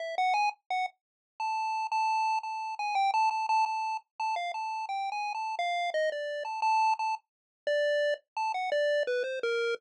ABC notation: X:1
M:2/4
L:1/16
Q:1/4=86
K:none
V:1 name="Lead 1 (square)"
e _g _a z g z3 | a3 a3 a2 | _a g =a a a a2 z | a f a2 (3g2 _a2 =a2 |
f2 _e d2 a a2 | a z3 d3 z | a _g d2 B c _B2 |]